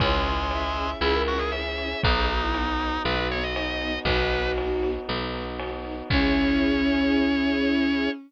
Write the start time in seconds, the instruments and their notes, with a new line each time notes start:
0.00 electric bass (finger) C#2, drawbar organ G#3, string ensemble 1 C#4 E4 G#4, brass section C#4 E4 G#4, violin C#5, kick, ride
0.12 violin C#5
0.25 string ensemble 1 C#4 E4 G#4, ride
0.39 violin C#5
0.51 string ensemble 1 C#4 E4 G#4, violin E5, ride
0.76 string ensemble 1 C#4 E4 G#4, ride
1.01 electric bass (finger) C#2, string ensemble 1 C#4 E4 G#4, drawbar organ E4, violin G#4, snare
1.14 violin A#4
1.27 string ensemble 1 C#4 E4 G#4, drawbar organ F#4, ride
1.38 drawbar organ G#4
1.52 string ensemble 1 C#4 E4 G#4, violin G#4, drawbar organ E5, ride
1.78 string ensemble 1 C#4 E4 G#4, ride
2.03 electric bass (finger) B1, string ensemble 1 B3 D#4 F#4, brass section B3 D#4 F#4, drawbar organ D#4, violin F#4, kick, ride
2.15 violin G#4
2.28 string ensemble 1 B3 D#4 F#4, violin F#4, ride
2.42 violin E4
2.54 string ensemble 1 B3 D#4 F#4, violin D#4, ride
2.79 string ensemble 1 B3 D#4 F#4, ride
3.05 electric bass (finger) B1, string ensemble 1 B3 D#4 F#4, violin F#4, drawbar organ B4, snare
3.17 violin F#4
3.30 string ensemble 1 B3 D#4 F#4, drawbar organ C#5, ride
3.43 drawbar organ D#5
3.56 string ensemble 1 B3 D#4 F#4, violin D#4, drawbar organ D#5, ride
3.81 string ensemble 1 B3 D#4 F#4, ride
4.05 electric bass (finger) B1, string ensemble 1 B3 D#4 F#4, brass section B3 D#4 F#4, violin D#4 F#4, drawbar organ B4, kick, ride
4.32 string ensemble 1 B3 D#4 F#4, ride
4.58 string ensemble 1 B3 D#4 F#4, ride
4.83 string ensemble 1 B3 D#4 F#4, ride
5.08 electric bass (finger) B1, string ensemble 1 B3 D#4 F#4, snare
5.34 string ensemble 1 B3 D#4 F#4, ride
5.59 string ensemble 1 B3 D#4 F#4, ride
5.85 string ensemble 1 B3 D#4 F#4, ride
6.10 electric bass (finger) C#2, brass section C#4 E4 G#4, violin C#4, string ensemble 1 C#4 E4 G#4, drawbar organ C#5, kick, crash